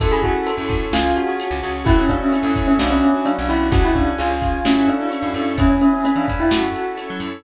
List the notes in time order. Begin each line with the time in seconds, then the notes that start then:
0.00 F#2 C#4 E4 F#4 A4, kick, closed hi-hat
0.12 G#4
0.23 C#4 E4 F#4 A4, kick, closed hi-hat
0.47 C#4 E4 A4 C#5, closed hi-hat
0.57 F#2 C#4 E4 F#4 A4
0.69 F#2, kick, closed hi-hat
0.92 C#2 C#4 F4 G#4, snare
1.16 F#4, closed hi-hat
1.27 C#4 F4 G#4
1.40 C#4 G#4 C#5, closed hi-hat
1.51 C#2 C#4 F4 G#4
1.63 C#2 C#4 F4 G#4, closed hi-hat
1.85 F#2 C#4 E4 F#4 A4, kick, closed hi-hat
1.98 C#4
2.09 C#4 D4 E4 F#4 A4, kick, closed hi-hat
2.21 C#4
2.32 C#4 E4 A4 C#5, closed hi-hat
2.43 F#2 C#4 E4 F#4 A4
2.56 F#2, kick, closed hi-hat
2.67 C#4
2.79 B1 B3 C#4 D4 F#4, snare
2.91 C#4
3.02 closed hi-hat
3.14 B3 C#4 D4 F#4
3.25 F#3 B3 C#4 D4 F#4, closed hi-hat
3.38 B1 B3 C#4 D4 F#4
3.48 B1 B3 C#4 D4 E4 F#4, closed hi-hat
3.71 C#2 C#4 F#4 G#4, kick, closed hi-hat
3.84 E4
3.95 C#4 D4 F#4 G#4, kick, closed hi-hat
4.18 C#2 C#4 F4 G#4, closed hi-hat
4.30 C#4 F4 G#4
4.42 kick, closed hi-hat
4.65 F#2 C#4 E4 F#4 A4, snare
4.88 D4, closed hi-hat
4.99 C#4 E4 F#4 A4
5.10 C#4 E4 A4 C#5, closed hi-hat
5.22 F#2 C#4 E4 F#4 A4
5.34 F#2 C#4 E4 F#4 A4, closed hi-hat
5.58 E2 B3 C#4 E4 G#4, kick, closed hi-hat
5.70 C#4
5.81 C#4, closed hi-hat
5.93 C#4
6.04 B3 C#4 G#4 B4, closed hi-hat
6.16 E3 D4
6.28 E2, kick, closed hi-hat
6.40 E4
6.50 F#2 C#4 E4 F#4 A4, snare
6.74 closed hi-hat
6.97 C#4 E4 A4 C#5, closed hi-hat
7.10 F#3
7.20 F#2, closed hi-hat